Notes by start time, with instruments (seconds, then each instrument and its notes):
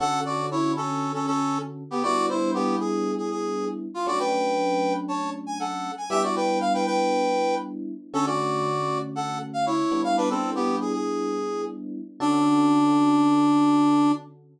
0.00 electric piano 1 D3 C#4 F#4 A4, brass section A4 F#5
0.25 brass section F#4 D5
0.51 brass section E4 C#5
0.76 brass section C#4 A4
1.14 brass section C#4 A4
1.27 brass section C#4 A4
1.91 brass section B3 G4
2.03 electric piano 1 G3 B3 D4 E4, brass section F#4 D5
2.29 brass section E4 C5
2.54 brass section B3 G4
2.80 brass section G#4
3.18 brass section G#4
3.30 brass section G#4
3.94 brass section F4
4.06 electric piano 1 F#3 A3 C#4 D4, brass section F#4 D5
4.19 brass section B4 G5
5.08 brass section C#5 A5
5.47 brass section G#5
5.60 brass section A4 F#5
5.97 brass section G#5
6.10 electric piano 1 G3 B3 D4 E4, brass section G4 E5
6.23 brass section F#4 D5
6.36 brass section B4 G5
6.61 brass section F5
6.74 brass section B4 G5
6.86 brass section B4 G5
8.13 electric piano 1 D3 A3 C#4 F#4, brass section C#4 A4
8.26 brass section F#4 D5
9.15 brass section A4 F#5
9.53 brass section F5
9.66 brass section E4 C#5
9.92 electric piano 1 G3 B3 D4 E4
10.04 brass section F5
10.17 brass section D4 B4
10.30 brass section C4 A4
10.55 brass section B3 G4
10.81 brass section G#4
10.93 brass section G#4
12.20 electric piano 1 D3 C#4 F#4 A4, brass section D4